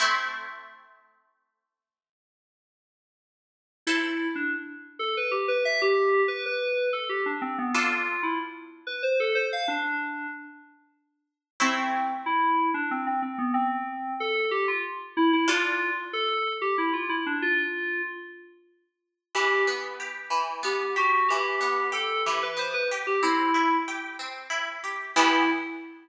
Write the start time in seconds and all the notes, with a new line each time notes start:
0.00 A3 C4 E4
3.87 E4 A4 C5 E5
4.35 D4
4.99 A4
5.17 B4
5.31 G4
5.48 B4
5.65 E5
5.82 G4
6.28 B4
6.46 B4
6.93 A4
7.09 G4
7.26 D4
7.42 C4
7.58 B3
7.74 D4 F4 A4
8.23 E4
8.87 B4
9.03 C5
9.20 A4
9.35 C5
9.53 F5
9.68 D4
11.60 A3 C4 E4 C5
12.26 E4
12.74 D4
12.91 C4
13.07 C4
13.22 C4
13.38 B3
13.54 C4
14.20 A4
14.51 G4
14.68 F4
15.17 E4
15.33 E4
15.48 D4 F4 A4
16.13 A4
16.62 G4
16.78 E4
16.93 F4
17.09 E4
17.26 D4
17.42 F4
19.35 E3 G4
19.67 B3
20.00 G4
20.30 E3
20.63 B3 G4
20.96 F#4 G4
21.28 E3 G4
21.61 B3
21.92 G4 A4
22.26 E3 G4
22.43 B4
22.57 B3 C5
22.74 B4
22.91 G4
23.07 G4
23.23 C4 E4
23.54 E4
23.88 G4
24.19 C4
24.50 E4
24.84 G4
25.16 E3 B3 E4 G4